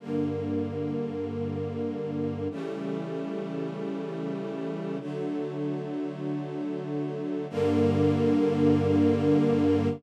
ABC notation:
X:1
M:3/4
L:1/8
Q:1/4=72
K:Gm
V:1 name="String Ensemble 1"
[G,,D,B,]6 | [^C,=E,G,A,]6 | [D,^F,A,]6 | [G,,D,B,]6 |]